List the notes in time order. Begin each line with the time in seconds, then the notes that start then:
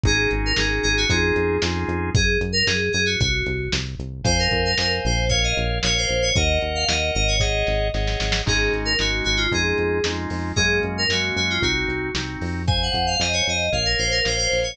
0.04 G#1 C#4 D#4 F#4 G#4, kick, closed hi-hat
0.31 G#1, closed hi-hat
0.46 A#4
0.56 G#1 C#4 D#4 F#4 G#4, snare
0.83 G#1 G#4, closed hi-hat
0.97 F#4
1.09 F2 C#4 D#4 F4 G#4, kick, closed hi-hat
1.36 F2, closed hi-hat
1.62 F2 C#4 D#4 F4 G#4, snare
1.88 F2, closed hi-hat
2.15 F#2 G#4, kick, closed hi-hat
2.41 F#2, closed hi-hat
2.52 A#4
2.67 F#2 G#4, snare
2.93 F#2 G#4, closed hi-hat
3.06 F#4
3.20 C2 F#4, kick, closed hi-hat
3.46 C2, closed hi-hat
3.72 C2, snare
3.99 C2, closed hi-hat
4.24 F2 C5 F5 G#5, kick, closed hi-hat
4.39 A#4
4.51 F2, kick, closed hi-hat
4.65 A#4
4.78 F2 A#4 C5 F5 G#5, snare
5.05 A#1 C5, closed hi-hat
5.29 A#4 C#5 F5, kick, closed hi-hat
5.44 D#5
5.57 A#1, closed hi-hat
5.83 A#1 A#4 C#5 F5, snare
5.98 C5
6.09 A#1, closed hi-hat
6.22 C#5
6.35 D#2 A#4 D#5 F#5, kick, closed hi-hat
6.61 D#2, closed hi-hat
6.75 F5
6.88 D#2 A#4 D#5 F#5, snare
7.15 G#1 D#5, closed hi-hat
7.28 C#5
7.39 G#4 C#5 D#5 F#5, kick, snare
7.67 G#1, snare
7.94 G#1 G#4 C#5 D#5 F#5, snare
8.07 snare
8.20 G#1, snare
8.32 snare
8.46 G#1 G#3 C#4 D#4 F#4 G#4, kick, crash
8.73 G#1, closed hi-hat
8.85 A#4
8.99 G#1 G#3 C#4 D#4 F#4, snare
9.24 G#1 F#4, closed hi-hat
9.37 F4
9.52 F2 G#3 C#4 D#4 F4 G#4, kick, closed hi-hat
9.78 F2, closed hi-hat
10.04 F2 G#3 C#4 D#4 F4, snare
10.30 F2, open hi-hat
10.56 F#2 G#3 A#3 C#4 F#4 G#4, kick, closed hi-hat
10.83 F#2, closed hi-hat
10.98 A#4
11.09 F#2 G#3 A#3 C#4 F#4, snare
11.36 F#2 F#4, closed hi-hat
11.50 F4
11.62 C2 C4 D#4 F#4, kick, closed hi-hat
11.88 C2, closed hi-hat
12.14 C2 C4 D#4 F#4, snare
12.41 F2, open hi-hat
12.67 C5 F5 G#5, kick, closed hi-hat
12.83 F#5
12.94 F2, kick, closed hi-hat
13.07 F5
13.19 F2 C5 D#5 F5 G#5, snare
13.33 C#5
13.46 F2 D#5, closed hi-hat
13.72 A#1 A#4 C#5 F5, kick, closed hi-hat
13.85 A#4
13.99 A#1 C5, closed hi-hat
14.11 A#4
14.24 A#1 A#4 C5 C#5 F5, snare
14.38 C5
14.52 A#1, open hi-hat
14.63 C#5